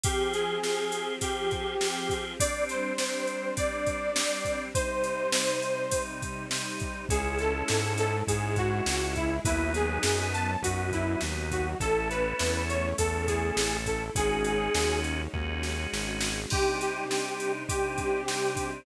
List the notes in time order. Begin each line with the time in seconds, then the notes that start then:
0.03 F3 C4 G4 G#4, kick, ride
0.33 G#4, ride
0.63 F3 C4 G4 G#4, snare
0.92 ride
1.21 F3 C4 G4 G#4, kick, ride
1.51 kick, ride
1.80 F3 C4 G4 G#4, snare
2.09 kick, ride
2.40 G3 C4 D4 D5, kick, ride
2.69 C5, ride
2.98 G3 C4 D4, snare
3.27 ride
3.57 G3 C4 D4 D5, kick, ride
3.86 kick, ride
4.16 G3 C4 D4, snare
4.45 kick, ride
4.74 C3 G3 D#4 C5, kick, ride
5.04 ride
5.32 C3 G3 D#4, snare
5.62 ride
5.91 C3 G3 D#4, kick, ride
6.22 kick, ride
6.51 C3 G3 D#4, snare
6.80 kick, ride
7.09 C#2 G#3 C#4 E4 G#4, kick, ride
7.38 A4, ride
7.68 G#2, snare
7.98 A4, ride
8.27 G#2 G#3 C#4 E4 G#4, kick, ride
8.56 F#4, kick, ride
8.86 C#2, snare
9.16 E4, kick, ride
9.45 D#2 F#3 B3 D#4 E4, kick, ride
9.74 G#4, ride
10.03 F#2, snare
10.33 A5, ride
10.62 F#2 F#3 B3 D#4 F#4, kick, ride
10.92 E4, kick, ride
11.21 D#2, snare
11.51 F#4, kick, ride
11.80 A1 A3 C#4 E4 A4, kick, ride
12.10 B4, ride
12.39 E2, snare
12.69 C#5, ride
12.98 E2 A3 C#4 E4 A4, kick, ride
13.27 G#4, kick, ride
13.57 A1, snare
13.86 A4, kick, ride
14.15 G#1 G#3 C#4 D#4 F#4 G#4, kick, ride
14.44 ride
14.75 D#2, snare
15.04 ride
15.33 D#2 G#3 C#4 D#4 F#4 G#4, kick
15.63 snare
15.93 G#1, snare
16.20 snare
16.50 C3 G3 D4 D#4 G4, kick, crash
16.81 G4, ride
17.10 C3 G3 D4 D#4, snare
17.40 ride
17.67 C3 G3 C4 D4 D#4 G4, kick, ride
17.98 kick, ride
18.27 C3 G3 D4 D#4, snare
18.56 kick, ride